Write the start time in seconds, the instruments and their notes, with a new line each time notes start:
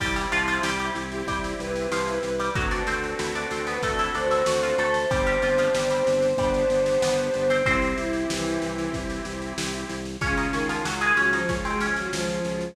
0.00 drawbar organ C2, harpsichord G3 G4, accordion C4 E4 G4, kick, snare, crash
0.16 harpsichord G3 G4, snare
0.32 drawbar organ C2, harpsichord F3 F4, snare
0.48 harpsichord F3 F4, snare
0.63 drawbar organ C2, harpsichord G3 G4, snare
0.79 harpsichord G3 G4, snare
0.95 drawbar organ C2, snare
1.12 violin G4, snare
1.27 drawbar organ C2, harpsichord G3 G4, kick, snare
1.44 snare
1.60 drawbar organ C2, violin B4, snare
1.76 snare
1.91 drawbar organ C2, harpsichord F3 F4, snare
2.07 snare
2.23 drawbar organ C2, snare
2.39 harpsichord G3 G4, snare
2.55 drawbar organ D2, harpsichord F#3 F#4, accordion C4 D4 F#4 A4, kick, snare
2.71 harpsichord D4 D5, snare
2.87 drawbar organ D2, harpsichord C4 C5, snare
3.03 snare
3.19 drawbar organ D2, harpsichord E4 E5, snare
3.35 harpsichord D4 D5, snare
3.51 drawbar organ D2, harpsichord C4 C5, snare
3.67 harpsichord B3 B4, violin B4, snare
3.83 drawbar organ D2, harpsichord A3 A4, kick, snare
3.99 harpsichord E4 E5, snare
4.14 drawbar organ D2, harpsichord D4 D5, violin C5, snare
4.31 harpsichord E4 E5, snare
4.46 drawbar organ D2, harpsichord F#4 F#5, snare
4.63 harpsichord F4 F5, snare
4.78 drawbar organ D2, harpsichord A3 A4, snare
4.94 snare
5.10 drawbar organ G1, harpsichord G3 G4, accordion C4 D4 G4, violin C5, kick, snare
5.27 harpsichord G3 G4, snare
5.42 drawbar organ G1, harpsichord F3 F4, snare
5.58 harpsichord F3 F4, snare
5.74 drawbar organ G1, harpsichord G3 G4, snare
5.90 harpsichord G3 G4, snare
6.07 drawbar organ G1, snare
6.22 snare
6.37 drawbar organ G1, harpsichord G3 G4, accordion B3 D4 G4, kick, snare
6.54 snare
6.70 drawbar organ G1, snare
6.86 snare
7.02 drawbar organ G1, harpsichord B3 B4, snare
7.18 snare
7.34 drawbar organ G1, snare
7.50 harpsichord C4 C5, snare
7.66 drawbar organ C2, accordion C4 E4 G4, harpsichord C4 C5, violin C4, kick, snare
7.82 snare
7.98 drawbar organ C2, violin E4, snare
8.13 snare
8.30 drawbar organ C2, violin E3, snare
8.46 snare
8.62 drawbar organ C2, snare
8.78 snare
8.93 drawbar organ C2, kick, snare
9.10 snare
9.25 drawbar organ C2, snare
9.42 snare
9.58 drawbar organ C2, snare
9.73 snare
9.89 drawbar organ C2, snare
10.05 snare
10.21 drawbar organ C#2, violin C#3, harpsichord C#4 C#5, accordion C#4 F4 G#4, kick, snare
10.37 harpsichord D#4 D#5, snare
10.52 drawbar organ C#2, violin D#3, harpsichord C#4 C#5, snare
10.68 violin D#3, harpsichord F3 F4, snare
10.85 drawbar organ C#2, harpsichord F#3 F#4, snare
11.01 harpsichord G#3 G#4, snare
11.17 drawbar organ C#2, violin F#3, harpsichord C#4 C#5, snare
11.33 violin F3, harpsichord D#4 D#5, snare
11.49 drawbar organ C#2, harpsichord C#4 C#5, accordion C#4 F4 G#4, kick, snare
11.65 violin G#3, harpsichord C4 C5, snare
11.80 drawbar organ C#2, harpsichord C#4 C#5, snare
11.96 violin F#3, snare
12.12 drawbar organ C#2, violin F3, snare
12.29 snare
12.45 drawbar organ C#2, snare
12.61 snare